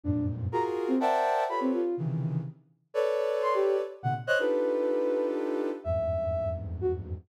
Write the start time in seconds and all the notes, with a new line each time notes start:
0.04 F2 F#2 G2 G#2 A#2 D4
0.52 F4 F#4 G#4 A#4 A#5
0.88 C4
1.00 A#4 C5 D5 E5 F#5 G5 A5
1.49 F4 G4 A4 B4 C#5 B5
1.61 C4
1.73 F4
1.97 C3 C#3 D#3 E3
2.94 A4 B4 C#5 D5
3.42 C6
3.54 G4
4.03 A#2 B2 C3 D3 F#5
4.27 C5 C#5 D#5 F#6
4.39 D4 D#4 F4 G4 A4 B4
5.84 E2 F2 G2 G#2 E5
6.81 F#4